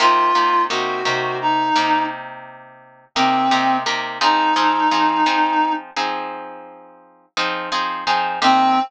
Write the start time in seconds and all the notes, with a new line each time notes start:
0.00 C3 A#3 D#4 F4 G4
0.35 C3 A#3 D#4 G4
0.69 C3 A#3 D#4 F#4 G4
1.05 C3 A#3 D#4 G4
1.41 D#4
1.76 C3 A#3 D#4 G4
3.15 C3 A#3 C4 D#4 G4
3.51 C3 A#3 D#4 G4
3.86 C3 A#3 D#4 G4
4.21 F3 C4 D#4 G#4
4.56 F3 C4 D#4 G#4
4.91 F3 C4 D#4 G#4
5.26 F3 C4 D#4 G#4
5.96 F3 C4 D#4 G#4
7.37 F3 C4 D#4 G#4
7.72 F3 C4 D#4 G#4
8.07 F3 C4 D#4 G#4
8.42 C3 A#3 C4 D#4 G4